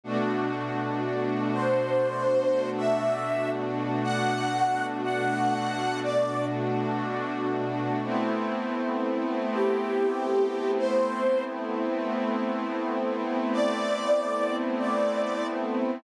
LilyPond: <<
  \new Staff \with { instrumentName = "Ocarina" } { \time 4/4 \key a \dorian \tempo 4 = 60 r4. c''4~ c''16 e''8. r8 | fis''4 fis''4 d''8 r4. | r4. g'4~ g'16 c''8. r8 | r4. d''4~ d''16 d''8. r8 | }
  \new Staff \with { instrumentName = "Pad 5 (bowed)" } { \time 4/4 \key a \dorian <b, a d' fis'>1~ | <b, a d' fis'>1 | <a b c' e'>1~ | <a b c' e'>1 | }
>>